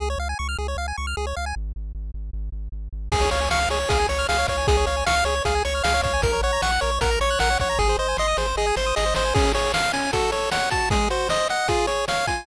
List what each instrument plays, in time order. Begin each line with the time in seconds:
0.00 synth bass 1 C#2, lead 1 (square) G#4
0.10 lead 1 (square) C#5
0.18 synth bass 1 C#2, lead 1 (square) F5
0.29 lead 1 (square) G#5
0.39 synth bass 1 C#2, lead 1 (square) C#6
0.49 lead 1 (square) F6
0.58 synth bass 1 C#2, lead 1 (square) G#4
0.68 lead 1 (square) C#5
0.76 synth bass 1 C#2, lead 1 (square) F5
0.88 lead 1 (square) G#5
0.97 synth bass 1 C#2, lead 1 (square) C#6
1.07 lead 1 (square) F6
1.17 synth bass 1 C#2, lead 1 (square) G#4
1.27 lead 1 (square) C#5
1.36 synth bass 1 C#2, lead 1 (square) F5
1.46 lead 1 (square) G#5
1.56 synth bass 1 G#1
1.76 synth bass 1 G#1
1.95 synth bass 1 G#1
2.14 synth bass 1 G#1
2.33 synth bass 1 G#1
2.52 synth bass 1 G#1
2.72 synth bass 1 G#1
2.93 synth bass 1 G#1
3.12 synth bass 1 C#2, lead 1 (square) G#4, kick, crash
3.21 lead 1 (square) C#5
3.31 synth bass 1 C#2, lead 1 (square) C#5 F5, closed hi-hat
3.41 lead 1 (square) G#5
3.50 synth bass 1 C#2, lead 1 (square) F5 C#6, snare
3.61 lead 1 (square) F6
3.69 synth bass 1 C#2, lead 1 (square) G#4 C#5, closed hi-hat
3.80 lead 1 (square) C#5
3.89 synth bass 1 C#2, lead 1 (square) G#4 F5, kick, closed hi-hat
4.00 lead 1 (square) G#5
4.09 synth bass 1 C#2, lead 1 (square) C#5 C#6, closed hi-hat
4.19 lead 1 (square) F6
4.29 synth bass 1 C#2, lead 1 (square) G#4 F5, snare
4.38 lead 1 (square) C#5
4.47 synth bass 1 C#2, lead 1 (square) C#5 F5, kick, closed hi-hat
4.58 lead 1 (square) G#5
4.67 synth bass 1 C#2, lead 1 (square) G#4, kick, closed hi-hat
4.77 lead 1 (square) C#5
4.86 synth bass 1 C#2, lead 1 (square) C#5 F5, closed hi-hat
4.97 lead 1 (square) G#5
5.06 synth bass 1 C#2, lead 1 (square) F5 C#6, snare
5.16 lead 1 (square) F6
5.24 synth bass 1 C#2, lead 1 (square) G#4 C#5, closed hi-hat
5.36 lead 1 (square) C#5
5.45 synth bass 1 C#2, lead 1 (square) G#4 F5, kick, closed hi-hat
5.55 lead 1 (square) G#5
5.65 synth bass 1 C#2, lead 1 (square) C#5 C#6, closed hi-hat
5.75 lead 1 (square) F6
5.84 synth bass 1 C#2, lead 1 (square) G#4 F5, snare
5.94 lead 1 (square) C#5
6.03 synth bass 1 C#2, lead 1 (square) C#5 F5, kick, closed hi-hat
6.13 lead 1 (square) G#5
6.22 synth bass 1 A#1, lead 1 (square) A#4, kick, closed hi-hat
6.33 lead 1 (square) C#5
6.41 synth bass 1 A#1, lead 1 (square) C#5 F#5, closed hi-hat
6.53 lead 1 (square) A#5
6.62 synth bass 1 A#1, lead 1 (square) F#5 C#6, snare
6.72 lead 1 (square) F#6
6.81 synth bass 1 A#1, lead 1 (square) A#4 C#5, closed hi-hat
6.92 lead 1 (square) C#5
7.01 synth bass 1 A#1, lead 1 (square) A#4 F#5, kick, closed hi-hat
7.11 lead 1 (square) A#5
7.20 synth bass 1 A#1, lead 1 (square) C#5 C#6, closed hi-hat
7.30 lead 1 (square) F#6
7.39 synth bass 1 A#1, lead 1 (square) A#4 F#5, snare
7.50 lead 1 (square) C#5
7.59 synth bass 1 A#1, lead 1 (square) C#5 F#5, kick, closed hi-hat
7.69 lead 1 (square) A#5
7.78 synth bass 1 G#1, lead 1 (square) G#4, kick, snare
7.89 lead 1 (square) C5
7.98 synth bass 1 G#1, lead 1 (square) C5 D#5
8.08 lead 1 (square) G#5
8.17 synth bass 1 G#1, lead 1 (square) D#5 C6, snare
8.28 lead 1 (square) D#6
8.37 synth bass 1 G#1, lead 1 (square) G#4 C5, snare
8.47 lead 1 (square) C5
8.56 synth bass 1 G#1, lead 1 (square) G#4 D#5, snare
8.67 lead 1 (square) G#5
8.76 synth bass 1 G#1, lead 1 (square) C5 C6, snare
8.86 lead 1 (square) D#6
8.96 synth bass 1 G#1, lead 1 (square) G#4 D#5, snare
9.06 lead 1 (square) C5
9.14 synth bass 1 G#1, lead 1 (square) C5 D#5, snare
9.25 lead 1 (square) G#5
9.34 lead 1 (square) C#4 G#4, kick, crash
9.54 lead 1 (square) G#4 C#5, closed hi-hat
9.74 lead 1 (square) F5, snare
9.93 lead 1 (square) C#4 G#5, closed hi-hat
10.13 lead 1 (square) F#4 A4, kick, closed hi-hat
10.32 lead 1 (square) A4 C#5, closed hi-hat
10.51 lead 1 (square) C#5 F#5, snare
10.70 lead 1 (square) F#4 A5, kick, closed hi-hat
10.90 lead 1 (square) G#3 G#4, kick, closed hi-hat
11.10 lead 1 (square) F#4 C5, closed hi-hat
11.29 lead 1 (square) C5 D#5, snare
11.49 lead 1 (square) D#5 F#5, closed hi-hat
11.68 lead 1 (square) F4 G#4, kick, closed hi-hat
11.87 lead 1 (square) G#4 C#5, closed hi-hat
12.08 lead 1 (square) C#5 F5, snare
12.27 lead 1 (square) F4 G#5, kick, closed hi-hat